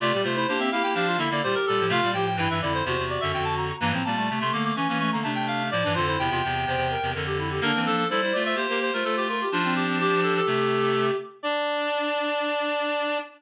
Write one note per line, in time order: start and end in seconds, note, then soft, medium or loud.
0.00 0.12 C3 loud
0.00 0.12 A3 loud
0.00 0.12 F4 loud
0.00 0.23 D5 loud
0.13 0.25 A#2 medium
0.13 0.25 G3 medium
0.13 0.24 G4 loud
0.24 0.46 C3 medium
0.24 0.46 A3 medium
0.24 0.35 F4 medium
0.24 0.35 C5 medium
0.35 0.47 E4 loud
0.35 0.47 C5 medium
0.48 0.70 A#3 medium
0.48 0.60 D4 medium
0.48 0.70 G4 loud
0.48 0.59 C5 medium
0.59 0.70 C4 medium
0.59 0.71 E5 medium
0.72 0.82 A#3 medium
0.72 0.94 E4 medium
0.72 0.82 G4 medium
0.72 0.83 F5 medium
0.83 0.94 A#3 medium
0.83 0.94 G4 medium
0.83 0.94 G5 medium
0.94 1.17 F3 medium
0.94 1.17 D4 loud
0.94 1.07 G4 medium
0.94 1.19 F5 medium
1.06 1.18 F4 medium
1.18 1.29 D3 medium
1.18 1.29 A#3 loud
1.18 1.41 E4 medium
1.18 1.30 E5 medium
1.30 1.42 D3 medium
1.30 1.42 A#3 loud
1.30 1.43 D5 medium
1.43 1.55 A#2 medium
1.43 1.55 G3 medium
1.43 1.89 G4 loud
1.43 1.55 C5 medium
1.55 1.66 A#4 medium
1.66 1.80 A#2 medium
1.66 1.80 G3 medium
1.66 1.86 A4 medium
1.80 1.91 A2 medium
1.80 1.91 F3 medium
1.89 2.00 C3 loud
1.89 2.00 A3 loud
1.89 2.10 F4 loud
1.89 2.11 F5 loud
2.03 2.14 A#2 medium
2.03 2.14 G3 medium
2.13 2.36 A2 medium
2.13 2.36 F3 medium
2.13 2.26 G4 loud
2.13 2.25 G5 medium
2.26 2.37 G5 medium
2.36 2.48 G2 medium
2.36 2.48 E3 loud
2.36 2.58 E4 medium
2.36 2.49 G5 medium
2.50 2.61 G2 medium
2.50 2.61 E3 medium
2.50 2.62 E5 medium
2.61 2.82 F2 medium
2.61 2.82 D3 medium
2.61 2.83 E4 loud
2.61 2.73 D5 medium
2.74 2.85 C5 medium
2.85 2.97 E2 medium
2.85 2.97 C3 loud
2.85 3.72 F#4 medium
2.85 3.04 C5 medium
2.98 3.18 E2 medium
2.98 3.18 C3 medium
3.10 3.21 D5 medium
3.21 3.33 F#2 medium
3.21 3.32 D3 medium
3.21 3.32 E5 loud
3.33 3.72 F2 medium
3.33 3.72 D3 medium
3.33 3.45 G5 medium
3.44 3.56 A5 loud
3.57 3.76 A#5 medium
3.80 3.92 G2 loud
3.80 3.92 E3 loud
3.80 3.92 A#3 loud
3.80 4.04 A#5 loud
3.91 4.02 A2 medium
3.91 4.02 F3 medium
3.91 4.04 C4 medium
4.04 4.29 A#2 medium
4.04 4.29 G3 medium
4.04 4.16 A#3 medium
4.04 4.15 A5 medium
4.16 4.28 A3 medium
4.16 4.27 A5 medium
4.28 4.39 C3 medium
4.28 4.39 A3 medium
4.28 4.41 A3 medium
4.28 4.39 A5 medium
4.40 4.51 C3 medium
4.40 4.51 A3 loud
4.40 4.53 A3 medium
4.40 4.53 C6 medium
4.53 4.72 D3 medium
4.53 4.75 A3 medium
4.53 4.72 A#3 medium
4.53 4.64 D6 medium
4.65 4.76 D6 medium
4.76 4.87 E3 medium
4.76 4.87 C#4 medium
4.76 4.88 C#4 medium
4.76 4.98 C#6 medium
4.88 5.10 E3 medium
4.88 4.99 A#3 medium
4.88 5.10 C#4 loud
4.99 5.22 A3 medium
4.99 5.11 C#6 medium
5.12 5.24 D3 medium
5.12 5.24 A#3 medium
5.12 5.24 A#5 medium
5.23 5.70 C3 medium
5.23 5.70 A3 medium
5.23 5.63 D4 loud
5.23 5.34 A5 medium
5.35 5.46 G5 medium
5.47 5.69 F5 medium
5.71 5.83 A2 medium
5.71 5.83 F3 loud
5.71 5.93 D5 loud
5.83 5.96 G2 medium
5.83 5.96 E3 medium
5.83 5.95 D4 loud
5.95 6.17 F2 medium
5.95 6.17 D3 loud
5.95 6.06 F4 medium
5.95 6.06 C5 medium
6.07 6.18 E4 medium
6.07 6.19 C5 medium
6.18 6.30 E2 medium
6.18 6.30 C3 medium
6.18 6.30 E4 medium
6.18 7.12 G5 loud
6.30 6.41 E2 medium
6.30 6.41 C3 loud
6.30 6.42 F4 medium
6.44 6.65 E2 medium
6.44 6.65 C3 medium
6.66 6.76 E2 medium
6.66 6.76 C3 medium
6.66 6.87 C5 medium
6.77 6.96 E2 medium
6.77 6.96 C3 medium
6.90 7.10 A#4 medium
7.02 7.14 E2 medium
7.02 7.14 C3 medium
7.14 7.60 F2 medium
7.14 7.60 D3 medium
7.14 7.25 A#4 medium
7.26 7.37 G4 medium
7.38 7.50 E4 medium
7.50 7.62 G4 medium
7.61 7.72 D3 loud
7.61 7.72 A#3 loud
7.61 8.04 A#3 medium
7.61 8.04 D4 loud
7.61 7.81 A#4 loud
7.75 7.87 E3 medium
7.75 7.87 C4 medium
7.86 8.06 F3 medium
7.86 8.06 D4 medium
7.86 7.96 A4 loud
7.97 8.08 A4 medium
8.10 8.21 G3 medium
8.10 8.21 E4 loud
8.10 8.21 A4 medium
8.10 8.41 C5 loud
8.21 8.33 G3 medium
8.21 8.33 E4 medium
8.21 8.33 C5 medium
8.33 8.55 A3 medium
8.33 8.55 F4 medium
8.33 8.44 D5 medium
8.45 8.66 C5 medium
8.45 8.57 E5 medium
8.55 8.67 A#3 medium
8.55 8.67 G4 medium
8.55 8.79 C5 medium
8.69 8.91 A#3 medium
8.69 8.91 G4 loud
8.69 8.80 A#4 medium
8.82 8.93 C5 medium
8.93 9.03 A3 medium
8.93 9.03 F4 medium
8.93 9.05 A#4 medium
8.93 9.23 C5 medium
9.04 9.43 A3 medium
9.04 9.43 F4 medium
9.04 9.16 A4 medium
9.17 9.28 G4 medium
9.28 9.49 F4 medium
9.28 9.41 A#4 medium
9.41 9.52 G4 medium
9.52 10.40 F3 loud
9.52 9.63 D4 loud
9.52 10.40 D4 loud
9.52 9.74 F4 medium
9.64 9.84 C4 medium
9.76 9.98 G4 medium
9.87 9.98 C4 medium
10.00 10.20 G4 medium
10.00 11.17 G4 loud
10.23 10.34 A4 medium
10.36 11.06 A4 medium
10.47 11.11 C3 medium
10.47 11.11 A3 loud
11.43 13.18 D4 loud
11.43 13.20 D4 loud
11.43 13.18 D5 loud